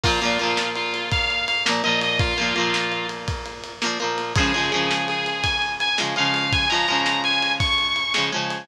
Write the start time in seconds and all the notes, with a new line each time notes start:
0.04 A#2 F3 A#3 F4, kick, crash
0.22 A#2 F3 A#3, ride
0.39 A#2 F3 A#3, ride
0.57 snare
0.76 F4, ride
0.94 ride
1.12 F5, kick, ride
1.30 ride
1.48 F5, ride
1.66 A#2 F3 A#3, snare
1.84 A#2 F3 A#3 D#5, ride
2.01 D#5, ride
2.19 F4, kick, ride
2.38 A#2 F3 A#3, ride
2.56 A#2 F3 A#3, ride
2.74 snare
2.92 ride
3.09 ride
3.28 kick, ride
3.46 ride
3.64 ride
3.82 A#2 F3 A#3, snare
4.00 A#2 F3 A#3, ride
4.18 ride
4.36 F3 G#3 G#4, kick, ride
4.40 C#3
4.54 C#3 F3 G#3, ride
4.72 C#3 F3 G#3, ride
4.91 snare
5.08 G#4, ride
5.26 ride
5.43 G#5, kick, ride
5.62 ride
5.80 G#5, ride
5.98 C#3 F3 G#3, snare
6.16 C#3 F3 G#3 F5, ride
6.34 F5, ride
6.52 G#5, kick, ride
6.69 F3 G#3 A#5, ride
6.74 C#3
6.88 C#3 F3 G#3, ride
7.06 snare
7.24 G#5, ride
7.42 ride
7.60 C#6, kick, ride
7.78 ride
7.96 ride
8.14 C#3 F3 G#3, snare
8.32 C#3 F3 G#3, ride
8.50 ride